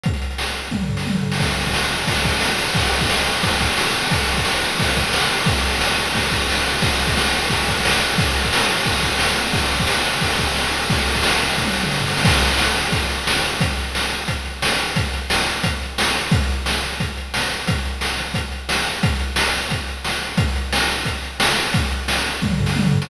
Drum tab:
CC |----------------|x---------------|----------------|----------------|
RD |----------------|-xxx-xxxxxxx-xxx|xxxx-xxxxxxx-xxx|xxxx-xxxxxxx-xxx|
HH |xxxx-xxx--------|----------------|----------------|----------------|
SD |-o--o------o---o|----o-------o---|----o-------o---|----o-------o---|
T1 |--------o---o---|----------------|----------------|----------------|
T2 |---------o---o--|----------------|----------------|----------------|
FT |----------o---o-|----------------|----------------|----------------|
BD |o-------o-------|o--o----o-o-----|o--o----o-o-----|o--o----o-o-----|

CC |----------------|----------------|----------------|----------------|
RD |xxxx-xxxxxxx-xxx|xxxx-xxxxxxx-xxx|xxxx-xxxxxxx-xxx|xxxx-xxxxxxx-xxx|
HH |----------------|----------------|----------------|----------------|
SD |----o-------o---|----o-------o---|----o-------o---|----o-------o---|
T1 |----------------|----------------|----------------|----------------|
T2 |----------------|----------------|----------------|----------------|
FT |----------------|----------------|----------------|----------------|
BD |o-------o-o-----|o--o----o-o-----|o--o----o-o-----|o--o----o-o-----|

CC |----------------|x---------------|----------------|----------------|
RD |xxxx-xxx--------|----------------|----------------|----------------|
HH |----------------|--x---x-x-x---x-|x-x---x-x-x---x-|x-x---x-x-x---x-|
SD |----o---o-o-o-oo|-o--o-------o---|-o--o-------o---|-o--o-------o---|
T1 |---------o------|----------------|----------------|----------------|
T2 |-----------o----|----------------|----------------|----------------|
FT |-------------o--|----------------|----------------|----------------|
BD |o--o----o-------|o-------o-------|o-------o-------|o-------o-------|

CC |----------------|----------------|----------------|----------------|
RD |----------------|----------------|----------------|----------------|
HH |x-x---x-x-x---x-|x-x---x-x-x---x-|x-x---x-x-x---x-|x-x---x-x-x---x-|
SD |-o--o-------o---|-o--o-------o---|-o--o-------o---|-o--o-------o---|
T1 |----------------|----------------|----------------|----------------|
T2 |----------------|----------------|----------------|----------------|
FT |----------------|----------------|----------------|----------------|
BD |o-------o-------|o-------o-------|o-------o-------|o-------o-------|

CC |----------------|
RD |----------------|
HH |x-x---x---------|
SD |-o--o------o---o|
T1 |--------o---o---|
T2 |---------o---o--|
FT |----------o---o-|
BD |o-------o-------|